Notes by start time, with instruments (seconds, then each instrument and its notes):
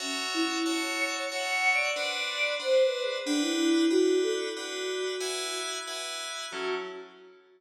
0.00 choir aahs C#4, electric piano 2 F#4 C#5 E5 A5
0.34 choir aahs E4
0.65 electric piano 2 F#4 C#5 E5 A5, choir aahs C#5
1.32 electric piano 2 F#4 C#5 E5 A5, choir aahs F#5
1.73 choir aahs D5
1.96 electric piano 2 D4 B4 C5 F#5
2.17 choir aahs D5
2.60 electric piano 2 D4 B4 C5 F#5, choir aahs C5
2.83 choir aahs B4
3.03 choir aahs G#4
3.26 choir aahs D4, electric piano 2 D4 B4 F#5 G5
3.41 choir aahs E4
3.90 electric piano 2 D4 B4 F#5 G5, choir aahs F#4
4.22 choir aahs A4
4.57 electric piano 2 D4 B4 F#5 G5, choir aahs F#4
5.20 electric piano 2 E4 B4 F#5 G#5
5.87 electric piano 2 E4 B4 F#5 G#5
6.51 electric piano 2 F#3 C#4 E4 A4, choir aahs F#4